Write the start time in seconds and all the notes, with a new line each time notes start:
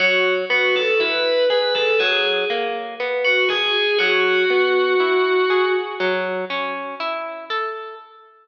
0.00 F#3 F#4
0.50 B3 F#4
0.76 A4
1.00 E4 B4
1.50 G#4 B4
1.75 A4
1.99 F#3 G#4
2.50 A#3
3.00 B3
3.25 F#4
3.49 G#4
3.98 F#3 F#4
4.50 B3
5.00 E4
5.50 G#4
6.00 F#3
6.50 C#4
7.00 E4
7.50 A4